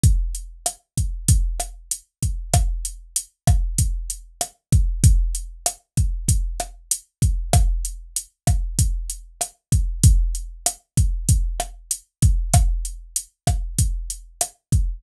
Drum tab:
HH |xxxxxxxx|xxxxxxxx|xxxxxxxx|xxxxxxxx|
SD |--r--r--|r--r--r-|--r--r--|r--r--r-|
BD |o--oo--o|o--oo--o|o--oo--o|o--oo--o|

HH |xxxxxxxx|xxxxxxxx|
SD |--r--r--|r--r--r-|
BD |o--oo--o|o--oo--o|